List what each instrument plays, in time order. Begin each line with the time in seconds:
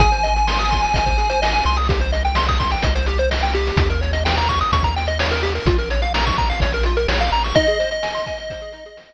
0.00 synth bass 1 G#1, lead 1 (square) G#4 G#5, kick, closed hi-hat
0.12 lead 1 (square) C5, closed hi-hat
0.23 lead 1 (square) D#5, closed hi-hat
0.35 lead 1 (square) G#5, closed hi-hat
0.47 lead 1 (square) C6, snare
0.58 lead 1 (square) D#6, closed hi-hat
0.71 lead 1 (square) C6, kick, closed hi-hat
0.83 lead 1 (square) G#5, closed hi-hat
0.94 synth bass 1 G#1, lead 1 (square) D#5, kick, closed hi-hat
1.06 lead 1 (square) C5, kick, closed hi-hat
1.18 lead 1 (square) G#4, closed hi-hat
1.30 lead 1 (square) C5, closed hi-hat
1.42 lead 1 (square) D#5, snare
1.53 lead 1 (square) G#5, closed hi-hat
1.64 synth bass 1 C2, lead 1 (square) C6, closed hi-hat
1.77 lead 1 (square) D#6, open hi-hat
1.89 lead 1 (square) G4, kick, closed hi-hat
2.00 lead 1 (square) C5, closed hi-hat
2.12 lead 1 (square) D#5, closed hi-hat
2.25 lead 1 (square) G5, closed hi-hat
2.35 lead 1 (square) C6, snare
2.48 lead 1 (square) D#6, kick, closed hi-hat
2.60 lead 1 (square) C6, kick, closed hi-hat
2.71 lead 1 (square) G5, closed hi-hat
2.82 synth bass 1 C2, lead 1 (square) D#5, kick, closed hi-hat
2.95 lead 1 (square) C5, closed hi-hat
3.06 lead 1 (square) G4, closed hi-hat
3.18 lead 1 (square) C5, closed hi-hat
3.31 lead 1 (square) D#5, snare
3.43 lead 1 (square) G5, closed hi-hat
3.53 lead 1 (square) G4, closed hi-hat
3.67 closed hi-hat
3.77 synth bass 1 D#2, kick, closed hi-hat
3.90 lead 1 (square) A#4, closed hi-hat
4.01 lead 1 (square) C#5, closed hi-hat
4.13 lead 1 (square) D#5, closed hi-hat
4.25 lead 1 (square) G5, snare
4.37 lead 1 (square) A#5, closed hi-hat
4.49 lead 1 (square) C#6, kick, closed hi-hat
4.61 lead 1 (square) D#6, closed hi-hat
4.72 synth bass 1 D#2, lead 1 (square) C#6, kick, closed hi-hat
4.83 lead 1 (square) A#5, kick, closed hi-hat
4.96 lead 1 (square) G5, closed hi-hat
5.07 lead 1 (square) D#5, closed hi-hat
5.19 lead 1 (square) C#5, snare
5.30 lead 1 (square) A#4, closed hi-hat
5.43 lead 1 (square) G4, closed hi-hat
5.55 lead 1 (square) A#4, closed hi-hat
5.66 synth bass 1 A#1, lead 1 (square) F4, kick, closed hi-hat
5.78 lead 1 (square) A#4, closed hi-hat
5.90 lead 1 (square) C#5, closed hi-hat
6.02 lead 1 (square) F5, closed hi-hat
6.14 lead 1 (square) A#5, snare
6.26 lead 1 (square) C#6, kick, closed hi-hat
6.38 lead 1 (square) A#5, kick, closed hi-hat
6.50 lead 1 (square) F5, closed hi-hat
6.60 synth bass 1 A#1, lead 1 (square) C#5, kick, closed hi-hat
6.72 lead 1 (square) A#4, closed hi-hat
6.83 lead 1 (square) F4, closed hi-hat
6.97 lead 1 (square) A#4, closed hi-hat
7.08 synth bass 1 A#1, lead 1 (square) C#5, snare
7.19 lead 1 (square) F5, closed hi-hat
7.32 synth bass 1 A1, lead 1 (square) A#5, closed hi-hat
7.44 lead 1 (square) C#6, closed hi-hat
7.55 lead 1 (square) D#4 D#5, kick, closed hi-hat
7.67 lead 1 (square) G#4, closed hi-hat
7.79 lead 1 (square) C5, closed hi-hat
7.91 lead 1 (square) D#5, closed hi-hat
8.03 lead 1 (square) G#5, snare
8.15 lead 1 (square) C6, closed hi-hat
8.26 lead 1 (square) G#5, kick, closed hi-hat
8.38 lead 1 (square) D#5, closed hi-hat
8.50 lead 1 (square) C5, kick, closed hi-hat
8.60 lead 1 (square) G#4, closed hi-hat
8.73 lead 1 (square) D#4, closed hi-hat
8.85 lead 1 (square) G#4, closed hi-hat
8.97 lead 1 (square) C5, snare
9.09 lead 1 (square) D#5, closed hi-hat